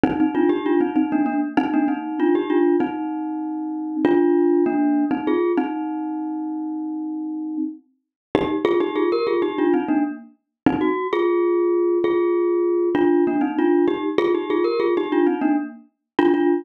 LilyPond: \new Staff { \time 9/8 \key ees \major \tempo 4. = 65 <c' ees'>16 <c' ees'>16 <d' f'>16 <ees' g'>16 <d' f'>16 <c' ees'>16 <c' ees'>16 <bes d'>16 <bes d'>16 r16 <c' ees'>16 <bes d'>16 <c' ees'>8 <d' f'>16 <ees' g'>16 <d' f'>8 | <c' ees'>2 <d' f'>4 <bes d'>8. <c' ees'>16 <f' aes'>8 | <c' ees'>2.~ <c' ees'>8 r4 | \key c \minor <ees' g'>16 r16 <f' aes'>16 <ees' g'>16 <f' aes'>16 <g' bes'>16 <f' aes'>16 <ees' g'>16 <d' f'>16 <c' ees'>16 <bes d'>16 r4 <c' ees'>16 ges'8 |
<f' aes'>4. <f' aes'>4. <d' f'>8 <bes d'>16 <c' ees'>16 <d' f'>8 | <ees' g'>16 r16 <f' aes'>16 <ees' g'>16 <f' aes'>16 <g' bes'>16 <f' aes'>16 <ees' g'>16 <d' f'>16 <c' ees'>16 <bes d'>16 r4 <d' f'>16 <d' f'>8 | }